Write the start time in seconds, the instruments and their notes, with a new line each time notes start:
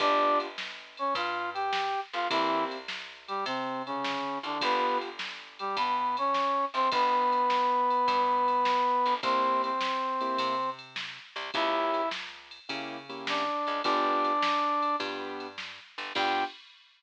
0.00 electric bass (finger) G1, acoustic grand piano B3 D4 F4 G4, brass section D4 D5, kick, ride
0.40 ride
0.58 snare
0.97 brass section C#4 C#5, ride
1.15 electric bass (finger) G2, brass section F4 F5, kick, ride
1.54 brass section G4 G5, ride
1.73 snare
2.13 electric bass (finger) G1, brass section F4 F5, ride
2.30 electric bass (finger) C2, brass section E3 E4, acoustic grand piano A#3 C4 E4 G4, kick, ride
2.71 ride
2.88 snare
3.28 brass section G3 G4, ride
3.46 electric bass (finger) C3, brass section C3 C4, kick, ride
3.86 brass section C#3 C#4, ride
4.04 snare
4.43 electric bass (finger) C2, brass section D3 D4, ride
4.61 electric bass (finger) G1, acoustic grand piano B3 D4 F4 G4, brass section B3 B4, kick, ride
5.01 ride
5.19 snare
5.59 brass section G3 G4, ride
5.77 electric bass (finger) G2, brass section B3 B4, kick, ride
6.17 brass section C#4 C#5, ride
6.34 snare
6.74 electric bass (finger) G1, brass section C4 C5, ride
6.92 electric bass (finger) G1, brass section B3 B4, kick, ride
7.32 ride
7.50 snare
7.91 ride
8.08 electric bass (finger) G2, kick, ride
8.48 ride
8.65 snare
9.06 electric bass (finger) G1, ride
9.23 electric bass (finger) C2, acoustic grand piano A#3 C4 E4 G4, brass section C4 C5, kick, ride
9.64 brass section C4 C5, ride
9.81 snare
10.21 acoustic grand piano A#3 C4 E4 G4, ride
10.38 electric bass (finger) C3, kick, ride
10.79 ride
10.96 snare
11.36 electric bass (finger) C2, ride
11.54 electric bass (finger) C#2, acoustic grand piano A#3 C#4 E4 G4, brass section E4 E5, kick, ride
11.94 ride
12.11 snare
12.51 ride
12.69 electric bass (finger) C#3, acoustic grand piano A#3 C#4 E4 G4, kick, ride
13.09 acoustic grand piano A#3 C#4 E4 G4, ride
13.27 brass section D4 D5, snare
13.67 electric bass (finger) C#2, ride
13.84 electric bass (finger) G1, acoustic grand piano B3 D4 F4 G4, brass section D4 D5, kick, ride
14.25 ride
14.42 snare
14.82 ride
15.00 electric bass (finger) G2, acoustic grand piano B3 D4 F4 G4, kick, ride
15.40 ride
15.58 snare
15.98 electric bass (finger) G1, ride
16.15 electric bass (finger) G2, acoustic grand piano B3 D4 F4 G4, brass section G5, kick, crash